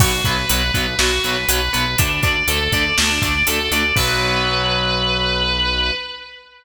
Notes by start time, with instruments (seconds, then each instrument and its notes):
0.00 synth bass 1 B1, overdriven guitar F#3 B3, distortion guitar F#4, kick, crash
0.24 synth bass 1 B1, overdriven guitar F#3 B3, distortion guitar B4, kick, closed hi-hat
0.49 synth bass 1 B1, overdriven guitar F#3 B3, distortion guitar B4, closed hi-hat
0.74 synth bass 1 B1, overdriven guitar F#3 B3, distortion guitar B4, kick, closed hi-hat
0.98 synth bass 1 B1, overdriven guitar F#3 B3, distortion guitar F#4, snare
1.24 synth bass 1 B1, overdriven guitar F#3 B3, distortion guitar B4, closed hi-hat
1.48 synth bass 1 B1, overdriven guitar F#3 B3, distortion guitar B4, closed hi-hat
1.73 synth bass 1 B1, overdriven guitar F#3 B3, distortion guitar B4, closed hi-hat
1.98 synth bass 1 D2, overdriven guitar A3 D4, distortion guitar D4, kick, closed hi-hat
2.22 synth bass 1 D2, overdriven guitar A3 D4, distortion guitar D5, kick, closed hi-hat
2.48 synth bass 1 D2, overdriven guitar A3 D4, distortion guitar A4, closed hi-hat
2.72 synth bass 1 D2, overdriven guitar A3 D4, distortion guitar D5, kick, closed hi-hat
2.98 synth bass 1 D2, overdriven guitar A3 D4, distortion guitar D4, snare
3.22 synth bass 1 D2, overdriven guitar A3 D4, distortion guitar D5, kick, closed hi-hat
3.47 synth bass 1 D2, overdriven guitar A3 D4, distortion guitar A4, closed hi-hat
3.71 synth bass 1 D2, overdriven guitar A3 D4, distortion guitar D5, closed hi-hat
3.96 synth bass 1 B1, overdriven guitar F#3 B3, distortion guitar B4, kick, crash